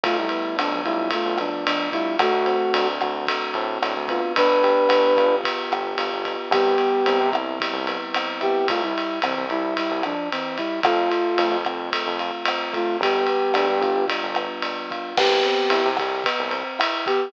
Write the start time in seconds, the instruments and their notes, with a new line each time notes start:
0.03 synth bass 1 B1, flute A3 F4, electric piano 1 A3, kick, ride
0.17 flute G3 E4
0.29 electric piano 1 B3, ride
0.56 synth bass 1 F2, flute F3 D4, electric piano 1 D4, cross-stick, ride
0.71 synth bass 1 B1
0.84 synth bass 1 B1, flute G3 E4, electric piano 1 F4, kick, ride
1.10 electric piano 1 A3, flute A3 F4, kick, ride
1.26 synth bass 1 B1
1.38 flute F3 D4, electric piano 1 B3, cross-stick, ride
1.66 flute F3 D4, electric piano 1 D4, ride
1.92 flute G3 E4, electric piano 1 F4, kick, ride
2.19 synth bass 1 D2, electric piano 1 A3, flute A3 F#4, kick, cross-stick, ride
2.32 synth bass 1 D2
2.46 electric piano 1 C4, ride
2.74 synth bass 1 D2, electric piano 1 D4, ride
3.01 synth bass 1 D2, electric piano 1 F#4, kick, cross-stick, ride
3.27 electric piano 1 A3, kick, ride
3.54 synth bass 1 A2, electric piano 1 C4, ride
3.82 synth bass 1 A2, electric piano 1 D4, cross-stick, ride
3.97 synth bass 1 D2
4.08 electric piano 1 B3, flute F4, kick, ride
4.36 synth bass 1 G1, flute D4 B4, kick, ride
4.49 synth bass 1 G1
4.63 electric piano 1 G4, ride
4.89 synth bass 1 G1, electric piano 1 B3, cross-stick, ride
5.17 synth bass 1 G1, electric piano 1 F4, kick, ride
5.44 electric piano 1 B3, kick, ride
5.71 synth bass 1 G1, electric piano 1 G4, cross-stick, ride
5.98 synth bass 1 G1, electric piano 1 F4, ride
6.12 synth bass 1 G1
6.25 electric piano 1 B3, kick, ride
6.51 synth bass 1 C2, electric piano 1 G3, flute B3 G4, kick, cross-stick, ride
6.78 electric piano 1 B3, ride
7.06 synth bass 1 C2, electric piano 1 C4, ride
7.21 synth bass 1 C3
7.33 synth bass 1 C2, electric piano 1 E4, kick, cross-stick, ride
7.60 electric piano 1 G3, kick, ride
7.73 synth bass 1 C2
7.87 electric piano 1 B3, ride
8.14 electric piano 1 C4, cross-stick, ride
8.41 flute B3 G4, electric piano 1 E4, kick, ride
8.68 synth bass 1 C2, flute A3 F4, kick, ride
8.83 flute G3 E4
8.98 ride
9.22 synth bass 1 C2, flute E3 C4, cross-stick, ride
9.38 synth bass 1 C2
9.49 synth bass 1 C2, flute G3 E4, kick, ride
9.77 flute G3 E4, kick, ride
9.91 synth bass 1 C2
10.03 flute F3 D4, cross-stick, ride
10.31 flute E3 C4, ride
10.57 flute G3 E4, kick, ride
10.83 synth bass 1 F2, flute A3 F4, electric piano 1 A3, kick, cross-stick, ride
11.11 electric piano 1 F4, ride
11.38 synth bass 1 F2, electric piano 1 A3, ride
11.51 synth bass 1 F2
11.65 synth bass 1 F2, electric piano 1 C4, kick, cross-stick, ride
11.92 electric piano 1 A3, kick, ride
12.07 synth bass 1 F2
12.19 electric piano 1 F4, ride
12.45 electric piano 1 C4, cross-stick, ride
12.73 electric piano 1 A3, flute A3 F4, kick, ride
13.01 synth bass 1 G1, electric piano 1 G3, flute B3 G4, kick, ride
13.27 electric piano 1 B3, ride
13.54 synth bass 1 D2, electric piano 1 D4, cross-stick, ride
13.68 synth bass 1 G2
13.81 synth bass 1 G1, electric piano 1 F4, kick, ride
14.08 electric piano 1 G3, kick, ride
14.23 synth bass 1 G1
14.35 electric piano 1 B3, cross-stick, ride
14.62 electric piano 1 D4, ride
14.90 electric piano 1 F4, kick, ride
15.17 synth bass 1 C2, electric piano 1 B3, flute B3 G4, kick, cross-stick, crash
15.43 electric piano 1 C4, ride
15.70 synth bass 1 C2, electric piano 1 E4, ride
15.85 synth bass 1 C3
15.97 synth bass 1 C2, electric piano 1 G4, kick, cross-stick, ride
16.24 electric piano 1 B3, kick, ride
16.39 synth bass 1 C2
16.51 electric piano 1 C4, ride
16.79 electric piano 1 E4, cross-stick, ride
17.06 flute B3 G4, electric piano 1 G4, kick, ride